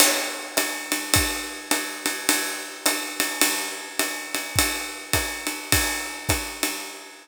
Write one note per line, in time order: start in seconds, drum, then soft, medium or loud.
0.00 crash medium
0.00 ride medium
0.57 hi-hat pedal medium
0.57 ride medium
0.92 ride medium
1.14 kick medium
1.14 ride medium
1.71 hi-hat pedal medium
1.71 ride medium
2.06 ride medium
2.29 ride medium
2.86 hi-hat pedal medium
2.86 ride medium
3.20 ride medium
3.41 ride medium
3.99 hi-hat pedal medium
3.99 ride medium
4.35 ride medium
4.56 kick soft
4.56 ride medium
5.13 kick soft
5.13 hi-hat pedal medium
5.13 ride medium
5.47 ride medium
5.72 kick medium
5.72 ride medium
6.29 kick medium
6.29 hi-hat pedal medium
6.29 ride medium
6.63 ride medium